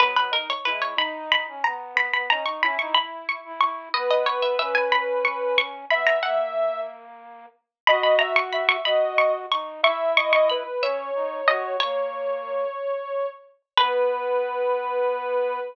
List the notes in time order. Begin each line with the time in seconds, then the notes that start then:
0.00 F#3 B3 B4
0.16 B4
0.31 D#4 A#4
0.50 C#5
0.65 G#3 E4 B4
0.82 C#5
0.97 D#4 B5
1.32 B5
1.48 C#4
1.64 B3 A#5
1.95 B3 B5
2.13 B3 B5
2.29 C#4 D#4 A#5
2.46 D#4 C#6
2.61 C#4 E4 B5
2.79 D#4 C#6
2.95 E4 B5
3.29 C#6
3.45 E4
3.61 E4 C#6
3.93 B3 B4 D#5
4.11 D#5
4.26 C#5
4.42 E5
4.58 C#4 E5
4.75 G#5
4.92 B5
5.25 C#6
5.58 C#6
5.90 B3 E5 B5
6.07 A#5
6.23 A#3 F#5
7.87 F#4 D#5 B5
8.03 B5
8.19 E5 A#5
8.36 C#6
8.53 E5 B5
8.69 C#6
8.85 F#4 D#5 B5
9.18 C#6
9.50 D#4 C#6
9.83 E4 E5 C#6
10.17 D#5 C#6
10.32 D#5 C#6
10.50 B4 B5
10.82 C#4 C#5 E5
11.14 D#4
11.48 F#4 D#5
11.80 A#3 C#5
13.77 B3 B4